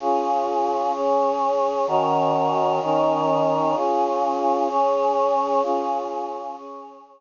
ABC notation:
X:1
M:6/8
L:1/8
Q:3/8=128
K:Db
V:1 name="Choir Aahs"
[DFA]6 | [DAd]6 | [E,DGB]6 | [E,DEB]6 |
[DFA]6 | [DAd]6 | [DFA]6 | [DAd]6 |]